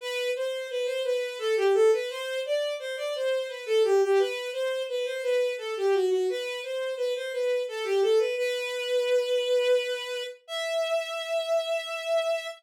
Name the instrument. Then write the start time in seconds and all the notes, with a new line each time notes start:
violin
0.01 B4
0.36 C5
0.70 B4
0.86 C5
1.04 B4
1.39 A4
1.57 G4
1.74 A4
1.93 B4
2.10 C5
2.45 D5
2.80 C5
2.97 D5
3.15 C5
3.49 B4
3.66 A4
3.84 G4
4.02 G4
4.19 B4
4.53 C5
4.89 B4
5.05 C5
5.23 B4
5.58 A4
5.77 G4
5.94 F#4
6.10 F#4
6.30 B4
6.63 C5
6.97 B4
7.16 C5
7.33 B4
7.68 A4
7.84 G4
8.02 A4
8.19 B4
8.37 B4
10.48 E5